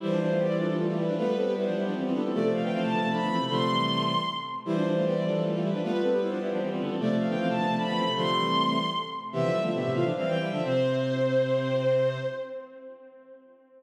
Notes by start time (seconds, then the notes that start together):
0.00 E3 G3 E4 C5
0.10 F3 D4
0.19 F3 D4 C5
0.29 A3 F4
0.38 B3 G4 D5
0.48 G3 E4
0.58 F3 D4 A4
0.69 F3 D4
0.78 A3 F4 A4
0.87 A3 F4 G4
0.97 G3 E4 B4
1.08 F3 D4
1.16 G3 A3 B3 F4 B4
1.26 A3 F4
1.36 C4 A4 B4
1.46 B3 G4
1.55 G3 E4 C5
1.66 F3 D4
1.75 G3 E4 G4
1.85 F3 D4
1.94 E3 C4 G4
2.03 E3 C4 F4
2.13 D3 B3 A4
2.23 E3 C4
2.33 C3 F3 A3 D5
2.42 C3 A3
2.52 C3 A3 F5
2.62 D3 B3 G5
2.72 E3 C4 F5
2.81 C3 A3 A5
2.91 D3 B3
3.02 C3 A3
3.10 F3 D4 B5
3.21 D3 B3
3.30 E3 C4
3.39 C3 A3
3.49 C3 D3 F3 A3 C6
3.70 E3 G3
4.65 E3 G3 E4 C5
4.75 F3 D4
4.86 F3 D4 C5
4.95 A3 F4
5.05 B3 G4 D5
5.14 G3 E4
5.25 F3 D4 A4
5.34 F3 D4
5.44 A3 F4 A4
5.53 A3 F4 G4
5.62 G3 E4 B4
5.73 F3 D4
5.83 G3 A3 B3 F4 B4
5.92 A3 F4
6.02 C4 A4 B4
6.11 B3 G4
6.21 G3 E4 C5
6.30 F3 D4
6.40 G3 E4 G4
6.51 F3 D4
6.60 E3 C4 G4
6.70 E3 C4 F4
6.80 D3 B3 A4
6.89 E3 C4
6.99 C3 F3 A3 D5
7.09 C3 A3
7.18 C3 A3 F5
7.28 D3 B3 G5
7.38 E3 C4 F5
7.47 C3 A3 A5
7.58 D3 B3
7.67 C3 A3
7.76 F3 D4 B5
7.87 D3 B3
7.96 E3 C4
8.06 C3 A3
8.15 C3 D3 F3 A3 C6
8.36 E3 G3
9.32 C3 E3 B3 G4 E5
9.42 D3 F3
9.52 E3 G3
9.62 D3 F3 A3 F4 E5
9.72 B2 D3 B3 G4 E5
9.84 A2 C3
9.93 C3 E3 A3 F4 F5
10.03 D3 F3 D4
10.16 E3 G3 C4 F5
10.26 E3 G3 C4 G5
10.38 E3 G3 E4
10.51 D3 F3 D4 E5
10.63 C3 C4 C5